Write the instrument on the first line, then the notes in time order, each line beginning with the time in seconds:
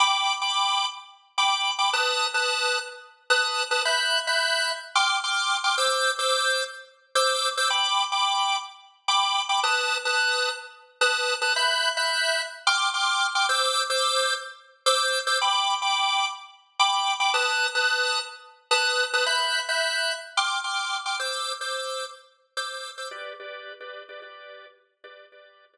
drawbar organ
0.00 G5 B5 D6
0.42 G5 B5 D6
1.38 G5 B5 D6
1.79 G5 B5 D6
1.93 B4 A5 D#6 F#6
2.34 B4 A5 D#6 F#6
3.30 B4 A5 D#6 F#6
3.71 B4 A5 D#6 F#6
3.85 E5 B5 F#6 G6
4.27 E5 B5 F#6 G6
4.95 G5 C6 D6 F6
5.24 G5 C6 D6 F6
5.64 G5 C6 D6 F6
5.78 C5 D6 E6 G6
6.19 C5 D6 E6 G6
7.15 C5 D6 E6 G6
7.57 C5 D6 E6 G6
7.70 G5 B5 D6
8.12 G5 B5 D6
9.08 G5 B5 D6
9.49 G5 B5 D6
9.64 B4 A5 D#6 F#6
10.05 B4 A5 D#6 F#6
11.01 B4 A5 D#6 F#6
11.42 B4 A5 D#6 F#6
11.56 E5 B5 F#6 G6
11.97 E5 B5 F#6 G6
12.67 G5 C6 D6 F6
12.94 G5 C6 D6 F6
13.35 G5 C6 D6 F6
13.49 C5 D6 E6 G6
13.90 C5 D6 E6 G6
14.86 C5 D6 E6 G6
15.27 C5 D6 E6 G6
15.42 G5 B5 D6
15.82 G5 B5 D6
16.79 G5 B5 D6
17.20 G5 B5 D6
17.34 B4 A5 D#6 F#6
17.75 B4 A5 D#6 F#6
18.71 B4 A5 D#6 F#6
19.13 B4 A5 D#6 F#6
19.26 E5 B5 F#6 G6
19.69 E5 B5 F#6 G6
20.37 G5 C6 D6 F6
20.64 G5 C6 D6 F6
21.06 G5 C6 D6 F6
21.19 C5 D6 E6 G6
21.61 C5 D6 E6 G6
22.57 C5 D6 E6 G6
22.98 C5 D6 E6 G6
23.11 G4 B4 D5
23.40 G4 B4 D5
23.81 G4 B4 D5
24.09 G4 B4 D5
24.22 G4 B4 D5
25.04 G4 B4 D5
25.32 G4 B4 D5
25.73 G4 B4 D5